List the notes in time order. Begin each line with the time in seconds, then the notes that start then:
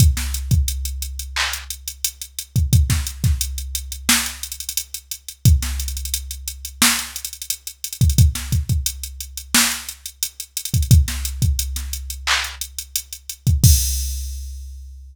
0.00 kick, closed hi-hat
0.17 snare, closed hi-hat
0.34 closed hi-hat
0.51 kick, closed hi-hat
0.68 closed hi-hat
0.85 closed hi-hat
1.02 closed hi-hat
1.19 closed hi-hat
1.36 clap
1.53 closed hi-hat
1.70 closed hi-hat
1.88 closed hi-hat
2.04 closed hi-hat
2.22 closed hi-hat
2.39 closed hi-hat
2.56 kick, closed hi-hat
2.73 kick, closed hi-hat
2.90 kick, snare, closed hi-hat
3.07 closed hi-hat
3.24 kick, snare, closed hi-hat
3.41 closed hi-hat
3.58 closed hi-hat
3.75 closed hi-hat
3.92 closed hi-hat
4.09 snare
4.26 closed hi-hat
4.43 closed hi-hat
4.52 closed hi-hat
4.60 closed hi-hat
4.69 closed hi-hat
4.77 closed hi-hat
4.94 closed hi-hat
5.11 closed hi-hat
5.28 closed hi-hat
5.45 kick, closed hi-hat
5.62 snare, closed hi-hat
5.80 closed hi-hat
5.88 closed hi-hat
5.97 closed hi-hat
6.05 closed hi-hat
6.14 closed hi-hat
6.31 closed hi-hat
6.48 closed hi-hat
6.65 closed hi-hat
6.82 snare
6.99 snare, closed hi-hat
7.16 closed hi-hat
7.25 closed hi-hat
7.33 closed hi-hat
7.42 closed hi-hat
7.50 closed hi-hat
7.67 closed hi-hat
7.84 closed hi-hat
7.93 closed hi-hat
8.01 kick, closed hi-hat
8.10 closed hi-hat
8.18 kick, closed hi-hat
8.35 snare, closed hi-hat
8.52 kick, closed hi-hat
8.69 kick, closed hi-hat
8.86 closed hi-hat
9.03 closed hi-hat
9.20 closed hi-hat
9.37 closed hi-hat
9.54 snare
9.72 closed hi-hat
9.89 closed hi-hat
10.06 closed hi-hat
10.23 closed hi-hat
10.40 closed hi-hat
10.57 closed hi-hat
10.65 closed hi-hat
10.74 kick, closed hi-hat
10.83 closed hi-hat
10.91 kick, closed hi-hat
11.08 snare, closed hi-hat
11.25 closed hi-hat
11.42 kick, closed hi-hat
11.59 closed hi-hat
11.76 snare, closed hi-hat
11.93 closed hi-hat
12.10 closed hi-hat
12.27 clap
12.44 closed hi-hat
12.61 closed hi-hat
12.79 closed hi-hat
12.96 closed hi-hat
13.12 closed hi-hat
13.29 closed hi-hat
13.47 kick, closed hi-hat
13.64 kick, crash